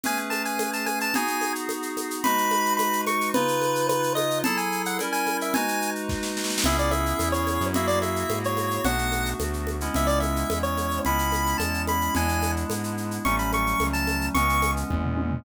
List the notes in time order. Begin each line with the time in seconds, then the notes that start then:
0.03 A3 C#4 G#4 B4 G#5, low conga, shaker
0.17 shaker
0.30 A5, high conga, shaker
0.45 G#5, shaker
0.59 high conga, shaker
0.73 A5, shaker
0.86 G#5, high conga, shaker
1.00 A5, shaker
1.14 B3 D#4 F#4 G#4 G#5, low conga, shaker
1.27 shaker
1.41 high conga, shaker
1.55 shaker
1.69 high conga, shaker
1.82 shaker
1.97 high conga, shaker
2.10 shaker
2.24 G#3 D#4 F#4 B4 B5, low conga, shaker
2.38 shaker
2.51 high conga, shaker
2.65 shaker
2.77 B5, high conga, shaker
2.93 shaker
3.07 C#6, high conga, shaker
3.21 shaker
3.34 C#3 D#4 F4 B4, low conga, shaker
3.48 shaker
3.61 high conga, shaker
3.75 shaker
3.89 B4, high conga, shaker
4.03 shaker
4.15 D#5, high conga, shaker
4.31 shaker
4.44 F#3 E4 G#4 A4 A5, low conga, shaker
4.57 G#5, shaker
4.72 shaker
4.85 F#5, shaker
4.99 G3 C#4 E4 A#4, high conga, shaker
5.12 G#5, shaker
5.26 high conga, shaker
5.41 E5, shaker
5.54 G#3 D#4 F#4 B4 G#5, low conga, shaker
5.68 shaker
5.82 shaker
5.95 shaker
6.09 kick, snare
6.23 snare
6.37 snare
6.44 snare
6.50 snare
6.58 snare
6.64 C#2 B3 C#4 E4 G#4 E5, low conga, shaker
6.78 D5, shaker
6.91 E5, high conga, shaker
7.06 shaker
7.19 E2, high conga, shaker
7.32 C#5, shaker
7.47 high conga, shaker
7.61 F#2, shaker
7.74 A#3 E4 F#4 G#4 E5, low conga, shaker
7.87 D5, shaker
8.02 E5, high conga, shaker
8.16 shaker
8.29 G#2, high conga, shaker
8.44 C#5, shaker
8.57 high conga, shaker
8.71 shaker
8.84 B1 A3 B3 D4 F#4 F#5, low conga, shaker
8.98 shaker
9.12 high conga, shaker
9.26 shaker
9.40 D2, high conga, shaker
9.53 shaker
9.67 high conga, shaker
9.81 G#3 B3 C#4 E4, shaker
9.94 C#2 E5, low conga, shaker
10.07 D5, shaker
10.20 E5, high conga, shaker
10.36 shaker
10.50 E2, high conga, shaker
10.63 C#5, shaker
10.77 high conga, shaker
10.91 shaker
11.05 C#2 G#3 B3 C#4 E4 B5, low conga, shaker
11.19 shaker
11.32 high conga, shaker
11.46 shaker
11.58 E2 A5, high conga, shaker
11.74 shaker
11.87 B5, high conga, shaker
12.01 shaker
12.15 E2 G#3 B3 D4 E4 G#5, low conga, shaker
12.29 shaker
12.42 high conga, shaker
12.56 shaker
12.70 G#2, high conga, shaker
12.84 shaker
12.97 shaker
13.11 shaker
13.25 A1 F#3 G3 A3 C#4 C#6, low conga, shaker
13.38 B5, shaker
13.52 C#6, high conga, shaker
13.67 shaker
13.80 C#2, high conga, shaker
13.93 A5, shaker
14.07 high conga, shaker
14.21 shaker
14.34 C#2 E3 G#3 B3 C#4 C#6, low conga, shaker
14.49 shaker
14.62 high conga, shaker
14.77 shaker
14.90 E2, kick, high tom
15.04 floor tom
15.17 high tom
15.31 floor tom